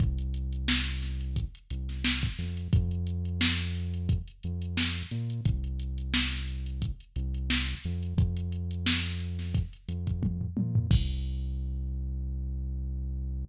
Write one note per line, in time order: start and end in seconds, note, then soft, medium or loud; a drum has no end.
0.00 1.45 C2 loud
0.00 kick medium
0.00 closed hi-hat medium
0.18 closed hi-hat medium
0.34 closed hi-hat medium
0.53 closed hi-hat medium
0.68 snare loud
0.87 closed hi-hat medium
1.02 snare soft
1.02 closed hi-hat medium
1.21 closed hi-hat medium
1.36 kick medium
1.36 closed hi-hat medium
1.55 closed hi-hat medium
1.70 2.29 C2 medium
1.70 closed hi-hat medium
1.89 snare soft
1.89 closed hi-hat medium
2.04 snare loud
2.23 kick medium
2.23 snare soft
2.23 closed hi-hat medium
2.39 2.68 F2 medium
2.39 snare soft
2.39 closed hi-hat medium
2.57 closed hi-hat medium
2.73 4.19 F2 loud
2.73 kick loud
2.73 closed hi-hat loud
2.91 closed hi-hat medium
3.07 closed hi-hat medium
3.25 closed hi-hat medium
3.41 snare loud
3.59 closed hi-hat medium
3.75 closed hi-hat medium
3.94 closed hi-hat medium
4.09 kick medium
4.09 closed hi-hat medium
4.28 closed hi-hat medium
4.43 5.03 F2 medium
4.43 closed hi-hat medium
4.62 closed hi-hat medium
4.77 snare medium
4.96 closed hi-hat medium
5.11 5.41 A#2 medium
5.11 closed hi-hat medium
5.30 closed hi-hat medium
5.45 6.92 C2 loud
5.45 kick medium
5.45 closed hi-hat medium
5.64 closed hi-hat medium
5.80 closed hi-hat medium
5.98 closed hi-hat medium
6.14 snare loud
6.32 snare soft
6.32 closed hi-hat medium
6.48 closed hi-hat medium
6.66 closed hi-hat medium
6.82 kick medium
6.82 closed hi-hat medium
7.00 closed hi-hat medium
7.16 7.75 C2 loud
7.16 closed hi-hat medium
7.34 closed hi-hat medium
7.50 snare medium
7.69 closed hi-hat medium
7.84 8.14 F2 medium
7.84 closed hi-hat medium
8.03 closed hi-hat medium
8.17 9.63 F2 loud
8.17 kick medium
8.17 closed hi-hat medium
8.37 closed hi-hat medium
8.52 closed hi-hat medium
8.71 closed hi-hat medium
8.86 snare loud
9.05 closed hi-hat medium
9.20 closed hi-hat medium
9.39 snare soft
9.39 closed hi-hat medium
9.55 kick medium
9.55 closed hi-hat loud
9.73 closed hi-hat medium
9.88 10.47 F2 medium
9.88 closed hi-hat medium
10.07 kick medium
10.07 closed hi-hat medium
10.23 kick medium
10.23 high tom medium
10.41 floor tom medium
10.57 10.87 A#2 medium
10.57 high tom medium
10.75 floor tom loud
10.90 13.45 C2 loud
10.90 kick loud
10.90 crash loud